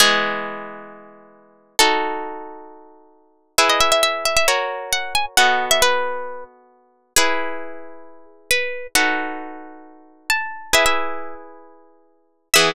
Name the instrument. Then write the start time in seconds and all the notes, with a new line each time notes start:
orchestral harp
0.00 E3 G#3 B3 G#4
1.79 D#4 F#4 A4
3.58 E4 G#4 B4 E5
3.69 D#5
3.81 E5
3.92 E5
4.03 E5
4.25 E5
4.37 E5
4.48 F#4 A#4 C#5
4.93 F#5
5.15 G#5
5.37 B3 F#4 A4 D#5 F#5
5.71 E5
5.82 B4
7.16 E4 G#4 B4
8.51 B4
8.95 D#4 F#4 A4 B4 F#5
10.30 A5
10.73 E4 G#4 B4 E5
10.86 E5
12.54 E3 B3 G#4 E5